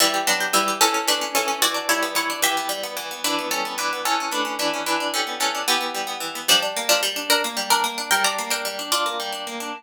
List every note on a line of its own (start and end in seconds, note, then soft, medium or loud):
0.00 0.53 E3 medium
0.00 0.24 G3 medium
0.00 0.24 E4 medium
0.14 0.40 G4 medium
0.27 0.53 F#3 medium
0.27 0.79 B3 medium
0.27 0.53 D4 medium
0.40 0.67 G4 medium
0.53 0.79 E3 medium
0.53 0.77 G3 medium
0.53 0.77 E4 medium
0.68 0.81 G4 medium
0.81 1.35 E3 loud
0.81 1.03 C#4 medium
0.81 1.03 A4 medium
0.94 1.21 C#4 medium
1.07 1.59 A3 medium
1.07 1.34 D4 medium
1.07 1.34 B4 medium
1.21 1.47 C#4 medium
1.35 1.62 E3 medium
1.35 1.59 C#4 medium
1.35 1.59 A4 medium
1.48 1.61 C#4 medium
1.62 2.15 E3 medium
1.62 1.87 F#4 medium
1.62 1.87 D5 medium
1.74 2.29 D4 medium
1.89 2.41 G3 medium
1.89 2.11 E4 medium
1.89 2.11 C#5 medium
2.03 2.41 B3 medium
2.15 2.41 E3 medium
2.15 2.39 E4 medium
2.15 2.39 C#5 medium
2.30 2.43 D4 medium
2.42 2.96 E3 loud
2.42 2.70 G4 medium
2.42 2.70 E5 medium
2.57 2.83 B3 medium
2.69 3.20 G3 medium
2.83 3.11 B3 medium
2.97 3.22 E3 medium
3.11 3.24 B3 medium
3.24 3.77 E3 loud
3.24 3.47 D4 medium
3.24 3.47 B4 medium
3.39 3.65 B3 medium
3.51 4.02 G3 medium
3.51 3.73 C#4 medium
3.51 3.73 A4 medium
3.65 3.92 B3 medium
3.78 4.03 E3 medium
3.78 4.02 D4 medium
3.78 4.02 B4 medium
3.93 4.06 B3 medium
4.05 4.58 E3 loud
4.05 4.31 C#4 medium
4.05 4.31 A4 medium
4.20 4.44 C#4 medium
4.31 4.83 A3 medium
4.31 4.58 D4 medium
4.31 4.58 B4 medium
4.45 4.73 C#4 medium
4.59 4.85 E3 medium
4.59 4.82 D4 medium
4.59 4.82 B4 medium
4.74 4.86 C#4 medium
4.86 5.40 E3 medium
4.86 5.11 D4 medium
4.86 5.11 B4 medium
5.00 5.54 D4 medium
5.14 5.66 G3 medium
5.14 5.39 C#4 medium
5.14 5.39 A4 medium
5.27 5.65 B3 medium
5.40 5.66 E3 medium
5.40 5.63 C#4 medium
5.40 5.63 A4 medium
5.55 5.67 D4 medium
5.68 6.20 E3 loud
5.68 6.11 B3 medium
5.68 6.11 G4 medium
5.81 6.06 B3 medium
5.94 6.46 G3 medium
6.07 6.35 B3 medium
6.20 6.46 E3 medium
6.35 6.48 B3 medium
6.48 6.60 F3 medium
6.48 7.02 G3 medium
6.48 6.60 D4 medium
6.62 7.16 D4 medium
6.77 7.44 A#3 medium
6.89 7.01 F3 medium
6.89 7.01 D4 medium
7.03 7.56 G3 loud
7.16 7.97 D4 medium
7.30 7.42 D4 medium
7.30 7.42 A#4 medium
7.44 7.83 A#3 medium
7.57 8.08 G3 medium
7.70 7.83 D4 medium
7.70 7.83 A#4 medium
7.84 8.09 A#3 medium
7.98 8.11 D4 medium
8.11 8.64 G3 medium
8.11 8.23 A#4 medium
8.11 8.23 G5 medium
8.24 8.50 D4 medium
8.24 8.49 D5 medium
8.24 8.49 A#5 medium
8.38 9.05 A#3 medium
8.50 8.78 D4 medium
8.50 8.84 A#4 medium
8.50 8.84 G5 medium
8.65 9.19 G3 medium
8.79 8.92 D4 medium
8.92 9.32 D4 medium
8.92 9.17 F4 medium
8.92 9.17 D5 medium
9.06 9.46 A#3 medium
9.20 9.71 G3 medium
9.32 9.60 D4 medium
9.47 9.73 A#3 medium
9.60 9.73 D4 medium